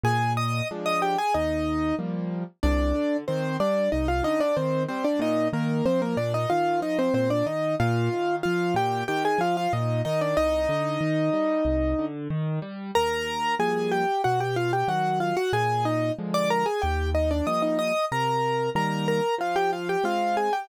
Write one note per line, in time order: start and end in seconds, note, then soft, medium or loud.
0.03 0.62 A#2 medium
0.03 0.33 G#4 medium
0.03 0.33 G#5 medium
0.37 0.68 D#5 medium
0.37 0.68 D#6 medium
0.71 1.16 F3 medium
0.71 1.16 G#3 medium
0.71 1.16 D4 medium
0.86 1.01 D#5 medium
0.86 1.01 D#6 medium
1.02 1.17 G4 medium
1.02 1.17 G5 medium
1.18 1.34 G#4 medium
1.18 1.34 G#5 medium
1.34 1.93 D#2 medium
1.34 1.95 D#4 medium
1.34 1.95 D#5 medium
1.99 2.44 F3 medium
1.99 2.44 G3 medium
1.99 2.44 A#3 medium
2.63 2.93 C2 loud
2.63 3.17 D4 medium
2.63 3.17 D5 medium
2.95 3.24 D3 medium
3.28 3.58 D#3 medium
3.28 3.57 C4 medium
3.28 3.57 C5 medium
3.60 3.89 G3 medium
3.60 3.90 D4 medium
3.60 3.90 D5 medium
3.92 4.22 C2 medium
3.92 4.07 D#4 medium
3.92 4.07 D#5 medium
4.08 4.24 F4 medium
4.08 4.24 F5 medium
4.23 4.52 D3 medium
4.23 4.40 D#4 medium
4.23 4.40 D#5 medium
4.40 4.56 D4 medium
4.40 4.56 D5 medium
4.57 4.86 D#3 medium
4.57 4.83 C4 medium
4.57 4.83 C5 medium
4.89 5.19 G3 medium
4.89 5.04 C4 medium
4.89 5.04 C5 medium
5.04 5.20 D4 medium
5.04 5.20 D5 medium
5.19 5.49 A#2 loud
5.19 5.48 D#4 medium
5.19 5.48 D#5 medium
5.53 5.82 D#3 medium
5.53 5.85 A#3 medium
5.53 5.85 A#4 medium
5.86 6.15 F3 medium
5.86 6.01 C4 medium
5.86 6.01 C5 medium
6.02 6.17 A#3 medium
6.02 6.17 A#4 medium
6.17 6.46 A#2 medium
6.17 6.33 D4 medium
6.17 6.33 D5 medium
6.34 6.49 D#4 medium
6.34 6.49 D#5 medium
6.50 6.80 D#3 medium
6.50 6.80 F4 medium
6.50 6.80 F5 medium
6.80 7.09 F3 medium
6.80 6.98 D#4 medium
6.80 6.98 D#5 medium
6.99 7.14 C4 medium
6.99 7.14 C5 medium
7.14 7.43 A#2 medium
7.14 7.30 C4 medium
7.14 7.30 C5 medium
7.30 7.46 D4 medium
7.30 7.46 D5 medium
7.46 7.75 D#3 medium
7.46 7.75 D#4 medium
7.46 7.75 D#5 medium
7.80 8.09 A#2 loud
7.80 8.36 F4 medium
7.80 8.36 F5 medium
8.13 8.42 D#3 medium
8.43 8.75 F3 medium
8.43 8.74 F4 medium
8.43 8.74 F5 medium
8.74 9.03 A#2 loud
8.74 9.04 G4 medium
8.74 9.04 G5 medium
9.08 9.37 D#3 loud
9.08 9.23 G4 medium
9.08 9.23 G5 medium
9.25 9.40 G#4 medium
9.25 9.40 G#5 medium
9.38 9.67 F3 medium
9.38 9.56 F4 medium
9.38 9.56 F5 medium
9.57 9.72 F4 medium
9.57 9.72 F5 medium
9.73 10.02 A#2 loud
9.73 10.01 D#4 soft
9.73 10.01 D#5 medium
10.05 10.35 D#3 medium
10.05 10.20 D#4 medium
10.05 10.20 D#5 medium
10.21 10.37 D4 medium
10.21 10.37 D5 medium
10.37 10.67 C2 loud
10.37 12.06 D#4 medium
10.37 12.06 D#5 medium
10.69 10.98 D3 loud
11.01 11.30 D#3 medium
11.33 11.62 G3 medium
11.65 11.94 C2 medium
11.99 12.28 D3 medium
12.30 12.59 D#3 medium
12.62 12.91 G3 medium
12.95 13.55 D#2 medium
12.95 13.55 A#4 medium
12.95 13.55 A#5 medium
13.59 14.04 F3 medium
13.59 14.04 G3 medium
13.59 14.04 A#3 medium
13.59 13.91 G#4 medium
13.59 13.91 G#5 medium
13.92 14.22 G4 medium
13.92 14.22 G5 medium
14.24 14.83 B2 medium
14.24 14.40 F#4 medium
14.24 14.40 F#5 medium
14.40 14.56 G4 medium
14.40 14.56 G5 medium
14.56 14.72 F4 medium
14.56 14.72 F5 medium
14.73 14.88 G4 soft
14.73 14.88 G5 medium
14.88 15.33 D#3 medium
14.88 15.33 F#3 medium
14.88 15.19 F#4 medium
14.88 15.19 F#5 medium
15.20 15.36 F4 medium
15.20 15.36 F5 medium
15.37 15.52 F#4 medium
15.37 15.52 F#5 medium
15.53 16.11 A#2 medium
15.53 15.85 G#4 medium
15.53 15.85 G#5 medium
15.85 16.12 D#4 medium
15.85 16.12 D#5 medium
16.19 16.64 D3 medium
16.19 16.64 F3 medium
16.19 16.64 G#3 medium
16.34 16.49 D5 medium
16.34 16.49 D6 medium
16.50 16.66 A#4 medium
16.50 16.66 A#5 medium
16.66 16.81 G#4 medium
16.66 16.81 G#5 medium
16.82 17.41 D#2 medium
16.82 17.10 G4 medium
16.82 17.10 G5 medium
17.15 17.30 D#4 medium
17.15 17.30 D#5 medium
17.31 17.46 D4 medium
17.31 17.46 D5 medium
17.47 17.92 F3 medium
17.47 17.92 G3 medium
17.47 17.92 A#3 medium
17.47 17.62 D#5 medium
17.47 17.62 D#6 medium
17.62 17.78 D#4 soft
17.62 17.78 D#5 medium
17.79 18.05 D#5 medium
17.79 18.05 D#6 medium
18.12 18.70 C3 medium
18.12 18.70 A#4 medium
18.12 18.70 A#5 medium
18.75 19.20 D#3 medium
18.75 19.20 G3 medium
18.75 19.20 A#3 medium
18.75 19.07 A#4 medium
18.75 19.07 A#5 medium
19.08 19.35 A#4 medium
19.08 19.35 A#5 medium
19.38 19.96 F3 medium
19.38 19.56 F4 medium
19.38 19.56 F5 medium
19.56 19.71 G4 medium
19.56 19.71 G5 medium
19.73 19.88 F4 soft
19.73 19.88 F5 medium
19.89 20.05 G4 medium
19.89 20.05 G5 medium
20.04 20.49 G#3 medium
20.04 20.49 C4 medium
20.04 20.36 F4 medium
20.04 20.36 F5 medium
20.37 20.52 G#4 soft
20.37 20.52 G#5 medium
20.53 20.68 G4 medium
20.53 20.68 G5 medium